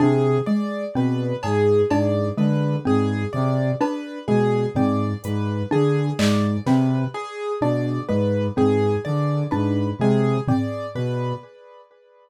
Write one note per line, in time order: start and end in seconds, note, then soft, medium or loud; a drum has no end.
0.00 0.38 C3 medium
0.00 0.38 D4 medium
0.00 0.38 G#4 medium
0.46 0.85 G#3 medium
0.46 0.85 D5 medium
0.95 1.33 B2 medium
0.95 1.34 C4 medium
0.95 1.35 B4 medium
1.43 1.82 G#2 medium
1.43 1.82 G#4 medium
1.43 cowbell loud
1.90 2.29 G#2 medium
1.90 2.29 D4 medium
1.90 2.29 D5 medium
1.90 cowbell loud
2.38 2.76 D3 medium
2.38 2.76 G#3 medium
2.38 2.76 B4 medium
2.85 3.24 G#2 medium
2.85 3.23 C4 medium
2.85 3.25 G#4 medium
3.33 3.72 C3 medium
3.33 3.71 D5 medium
3.81 4.19 D4 medium
3.81 4.19 B4 medium
3.81 cowbell loud
4.28 4.66 B2 medium
4.28 4.67 G#3 medium
4.28 4.66 G#4 medium
4.75 5.13 G#2 medium
4.75 5.14 C4 medium
4.75 5.14 D5 medium
4.75 floor tom loud
5.24 5.63 G#2 medium
5.24 5.63 B4 medium
5.24 closed hi-hat medium
5.71 6.10 D3 medium
5.71 6.09 D4 medium
5.71 6.11 G#4 medium
6.19 6.57 G#2 medium
6.19 6.57 G#3 medium
6.19 6.57 D5 medium
6.19 clap loud
6.66 7.04 C3 medium
6.66 7.06 C4 medium
6.66 7.05 B4 medium
6.66 snare medium
7.14 7.52 G#4 medium
7.61 7.99 B2 medium
7.61 8.00 D4 medium
7.61 8.00 D5 medium
8.09 8.48 G#2 medium
8.09 8.47 G#3 medium
8.09 8.47 B4 medium
8.57 8.96 G#2 medium
8.57 8.95 C4 medium
8.57 8.96 G#4 medium
8.57 floor tom medium
9.05 9.44 D3 medium
9.05 9.43 D5 medium
9.51 9.91 G#2 medium
9.51 9.90 D4 medium
9.51 9.89 B4 medium
9.99 10.38 C3 medium
9.99 10.39 G#3 medium
9.99 10.39 G#4 medium
10.48 10.87 C4 medium
10.48 10.86 D5 medium
10.48 floor tom loud
10.95 11.33 B2 medium
10.95 11.34 B4 medium